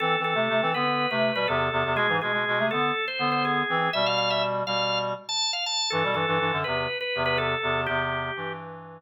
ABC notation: X:1
M:4/4
L:1/16
Q:1/4=122
K:Am
V:1 name="Drawbar Organ"
A2 A4 B3 B2 B A4 | ^G2 G4 A3 c2 c G4 | e f f e z2 f3 z2 a2 f a2 | A2 A4 B3 B2 B A4 |
G6 z10 |]
V:2 name="Clarinet"
(3[E,C]2 [E,C]2 [C,A,]2 [C,A,] [E,C] [D,B,]3 [C,A,]2 [B,,G,] [E,,C,]2 [E,,C,] [E,,C,] | [B,,^G,] [^G,,E,] [B,,G,] [B,,G,] [B,,G,] [C,A,] [D,B,]2 z2 [D,B,]4 [E,C]2 | [B,,G,]6 [B,,G,]4 z6 | [G,,E,] [B,,G,] [G,,E,] [G,,E,] [G,,E,] [^F,,D,] [E,,C,]2 z2 [E,,C,]4 [E,,C,]2 |
[E,,C,]4 [G,,E,]6 z6 |]